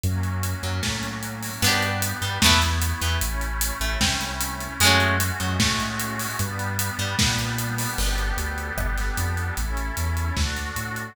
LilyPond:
<<
  \new Staff \with { instrumentName = "Orchestral Harp" } { \time 4/4 \key ges \lydian \tempo 4 = 151 r4. ges8 a2 | \key g \lydian <b d' g'>4 r8 g8 <a b e'>8 r4 e8 | r4. a8 c'2 | <gis a cis' fis'>4 r8 fis8 a2 |
r4. g8 ais2 | r1 | r1 | }
  \new Staff \with { instrumentName = "Synth Bass 2" } { \clef bass \time 4/4 \key ges \lydian ges,4. ges,8 a,2 | \key g \lydian g,4. g,8 e,4. e,8 | a,,4. a,,8 c,2 | fis,4. fis,8 a,2 |
g,4. g,8 ais,2 | g,,4 d,4 g,,4 f,4 | a,,4 e,4 d,4 a,4 | }
  \new Staff \with { instrumentName = "Pad 5 (bowed)" } { \time 4/4 \key ges \lydian <ges bes des'>1 | \key g \lydian <b d' g'>2 <a b e'>2 | <a cis' e'>1 | <gis a cis' fis'>1 |
<g b d'>1 | <b d' g' a'>1 | <cis' e' a'>2 <d' fis' a'>2 | }
  \new DrumStaff \with { instrumentName = "Drums" } \drummode { \time 4/4 hh8 hh8 hh8 hh8 <bd sn>8 <hh sn>8 hh8 hho8 | cymc8 hh8 hh8 hh8 <bd sn>8 <hh sn>8 hh8 hh8 | hh8 hh8 hh8 hh8 <bd sn>8 <hh sn>8 hh8 hh8 | hh8 hh8 hh8 hh8 <bd sn>8 <hh sn>8 hh8 hho8 |
hh8 hh8 hh8 hh8 <bd sn>8 <hh sn>8 hh8 hho8 | cymc8 hh8 hh8 hh8 <bd ss>8 <hh sn>8 hh8 hh8 | hh8 hh8 hh8 hh8 <bd sn>8 <hh sn>8 hh8 hh8 | }
>>